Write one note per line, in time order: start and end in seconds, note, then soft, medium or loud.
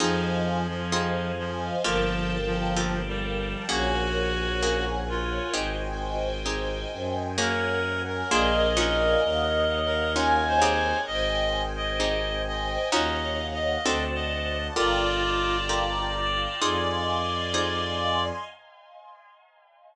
0.00 1.70 F2 medium
0.00 0.67 F3 loud
0.00 0.83 C4 medium
0.00 0.83 D#4 medium
0.00 0.83 F4 medium
0.00 0.83 G#4 medium
0.00 1.83 C5 medium
0.00 1.83 D#5 medium
0.00 1.83 F5 medium
0.00 1.83 G#5 medium
0.68 1.32 F3 loud
0.92 1.75 C4 medium
0.92 1.75 D#4 medium
0.92 1.75 F4 medium
0.92 1.75 G#4 medium
1.38 1.76 F3 loud
1.84 3.54 G1 loud
1.84 2.37 F3 loud
1.84 2.68 A#3 medium
1.84 2.68 F4 medium
1.84 2.68 G4 medium
1.84 2.68 A4 medium
1.84 3.67 A#4 medium
1.84 3.67 F5 medium
1.84 3.67 G5 medium
1.84 3.67 A5 medium
2.46 3.01 F3 loud
2.77 3.60 A#3 medium
2.77 3.60 F4 medium
2.77 3.60 G4 medium
2.77 3.60 A4 medium
3.07 3.65 G3 loud
3.69 5.39 A#1 loud
3.69 4.52 A#3 medium
3.69 4.52 C#4 medium
3.69 4.52 F#4 medium
3.69 4.85 F#4 loud
3.69 4.52 G#4 medium
3.69 5.52 A#4 medium
3.69 5.52 C#5 medium
3.69 5.52 F#5 medium
3.69 5.52 G#5 medium
4.63 5.46 A#3 medium
4.63 5.46 C#4 medium
4.63 5.46 F#4 medium
4.63 5.46 G#4 medium
5.09 5.54 F4 loud
5.53 6.85 G#1 medium
5.53 6.37 C4 medium
5.53 6.37 D#4 medium
5.53 6.37 G4 medium
5.53 6.37 G#4 medium
5.53 7.36 C5 medium
5.53 7.36 D#5 medium
5.53 7.36 G5 medium
5.53 7.36 G#5 medium
6.46 7.29 C4 medium
6.46 7.29 D#4 medium
6.46 7.29 G4 medium
6.46 7.29 G#4 medium
6.92 8.23 F#2 medium
7.38 8.21 A#3 loud
7.38 8.21 C#4 medium
7.38 8.21 F#4 medium
7.38 8.21 G#4 medium
7.38 8.30 A#4 medium
7.38 8.02 A#4 loud
7.38 8.30 C#5 medium
7.38 8.30 F#5 medium
7.38 8.30 G#5 medium
8.07 8.69 A#4 loud
8.31 9.16 A#1 loud
8.31 8.75 A#3 medium
8.31 8.75 D4 medium
8.31 8.75 F4 medium
8.31 8.75 G#4 medium
8.31 9.22 A#4 medium
8.31 9.22 D5 medium
8.31 10.11 D#5 medium
8.31 9.22 F5 medium
8.31 9.22 G#5 medium
8.77 10.06 C#4 medium
8.77 10.06 D#4 medium
8.77 10.06 F4 medium
8.77 10.06 F#4 medium
8.77 9.21 A#4 loud
9.23 10.93 D#2 loud
9.23 9.79 A#4 medium
9.23 11.06 C#5 medium
9.23 11.06 D#5 medium
9.23 11.06 F5 medium
9.23 11.06 F#5 medium
9.85 10.44 A#4 loud
10.15 10.60 C#4 medium
10.15 10.60 D#4 medium
10.15 10.60 F4 medium
10.15 10.60 F#4 medium
10.15 11.01 G#5 medium
10.47 10.98 C5 loud
10.62 11.91 C4 medium
10.62 11.91 D#4 medium
10.62 11.91 G4 medium
10.62 11.91 G#4 medium
11.07 12.78 G#1 medium
11.07 12.91 C5 medium
11.07 11.62 D#5 loud
11.07 12.91 D#5 medium
11.07 12.91 G5 medium
11.07 12.91 G#5 medium
11.76 12.42 D#5 loud
12.00 12.83 C4 medium
12.00 12.83 D#4 medium
12.00 12.83 G4 medium
12.00 12.83 G#4 medium
12.47 12.89 D#5 loud
12.91 13.77 D#2 medium
12.91 13.75 C#4 medium
12.91 13.75 D#4 loud
12.91 13.75 F4 medium
12.91 13.75 F#4 medium
12.91 13.84 C#5 medium
12.91 13.46 D#5 loud
12.91 13.84 D#5 medium
12.91 13.84 F5 medium
12.91 13.84 F#5 medium
13.53 14.05 D#5 loud
13.85 14.70 D2 medium
13.85 14.69 C4 medium
13.85 14.69 D4 medium
13.85 14.69 F#4 medium
13.85 14.69 A4 medium
13.85 14.76 C5 medium
13.85 14.76 D5 medium
13.85 14.76 F#5 medium
13.85 14.76 A5 medium
14.14 14.67 D#5 loud
14.76 16.47 G1 medium
14.76 15.59 F4 medium
14.76 15.57 F4 loud
14.76 15.59 G4 medium
14.76 15.59 A4 medium
14.76 15.59 A#4 medium
14.76 18.24 D5 medium
14.76 16.60 F5 medium
14.76 16.60 G5 medium
14.76 16.60 A5 medium
14.76 16.60 A#5 medium
15.69 16.52 F4 medium
15.69 16.52 G4 medium
15.69 16.52 A4 medium
15.69 16.52 A#4 medium
16.62 18.31 F2 medium
16.62 17.45 D#4 medium
16.62 17.45 F4 medium
16.62 17.45 G#4 medium
16.62 17.45 C5 medium
16.62 18.44 D#5 medium
16.62 18.44 F5 medium
16.62 18.44 G#5 medium
16.62 18.44 C6 medium
17.54 18.37 D#4 medium
17.54 18.37 F4 medium
17.54 18.37 G#4 medium
17.54 18.37 C5 medium